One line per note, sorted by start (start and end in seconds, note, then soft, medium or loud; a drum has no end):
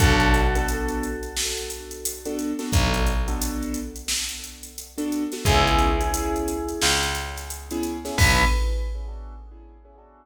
0.00 2.53 B1 loud
0.00 0.42 B3 loud
0.00 0.42 D4 loud
0.00 0.42 F#4 loud
0.00 2.32 F#4 medium
0.00 0.42 A4 loud
0.00 2.32 A4 medium
0.00 kick loud
0.00 closed hi-hat loud
0.20 closed hi-hat medium
0.34 closed hi-hat medium
0.55 1.07 B3 loud
0.55 1.07 D4 loud
0.55 1.07 F#4 loud
0.55 1.07 A4 loud
0.55 closed hi-hat medium
0.68 closed hi-hat medium
0.88 closed hi-hat medium
1.03 closed hi-hat medium
1.23 closed hi-hat medium
1.37 snare loud
1.58 closed hi-hat medium
1.70 closed hi-hat medium
1.91 closed hi-hat medium
2.05 closed hi-hat loud
2.25 2.51 B3 loud
2.25 2.51 D4 loud
2.25 2.51 F#4 medium
2.25 2.51 A4 medium
2.25 closed hi-hat medium
2.39 closed hi-hat medium
2.59 3.10 B3 loud
2.59 3.10 D4 loud
2.59 3.10 F#4 loud
2.59 3.10 A4 loud
2.59 snare medium
2.59 closed hi-hat medium
2.72 5.26 B1 medium
2.72 kick loud
2.72 closed hi-hat loud
2.94 closed hi-hat medium
3.07 closed hi-hat medium
3.28 3.79 B3 loud
3.28 3.79 D4 medium
3.28 3.79 F#4 medium
3.28 3.79 A4 loud
3.28 closed hi-hat medium
3.42 closed hi-hat loud
3.62 closed hi-hat medium
3.74 closed hi-hat medium
3.96 closed hi-hat medium
4.08 snare loud
4.29 closed hi-hat medium
4.44 closed hi-hat medium
4.63 closed hi-hat medium
4.78 closed hi-hat medium
4.98 5.23 B3 medium
4.98 5.23 D4 loud
4.98 5.23 F#4 medium
4.98 5.23 A4 loud
4.98 closed hi-hat medium
5.12 closed hi-hat medium
5.32 5.43 B3 medium
5.32 5.43 D4 medium
5.32 5.43 F#4 loud
5.32 5.43 A4 medium
5.32 snare medium
5.32 closed hi-hat medium
5.45 6.73 C#2 loud
5.45 5.88 B3 loud
5.45 5.88 C#4 loud
5.45 5.88 E4 loud
5.45 6.73 E4 medium
5.45 5.88 G#4 loud
5.45 6.73 G#4 medium
5.45 kick loud
5.45 closed hi-hat loud
5.67 closed hi-hat medium
5.79 closed hi-hat medium
6.01 6.52 B3 medium
6.01 6.52 C#4 loud
6.01 6.52 E4 medium
6.01 6.52 G#4 medium
6.01 closed hi-hat medium
6.14 closed hi-hat loud
6.36 closed hi-hat medium
6.48 closed hi-hat medium
6.68 closed hi-hat medium
6.82 8.10 C#2 medium
6.82 snare loud
7.03 closed hi-hat medium
7.15 closed hi-hat medium
7.36 snare soft
7.36 closed hi-hat medium
7.50 closed hi-hat medium
7.71 7.97 B3 medium
7.71 7.97 C#4 loud
7.71 7.97 E4 loud
7.71 7.97 G#4 loud
7.71 closed hi-hat medium
7.83 closed hi-hat medium
8.05 8.15 B3 medium
8.05 8.15 C#4 loud
8.05 8.15 E4 loud
8.05 8.15 G#4 medium
8.05 snare medium
8.05 closed hi-hat medium
8.18 8.44 B1 loud
8.18 8.44 B3 loud
8.18 8.44 D4 loud
8.18 8.44 F#4 loud
8.18 8.44 A4 loud
8.18 8.44 B4 loud
8.18 kick loud
8.18 crash loud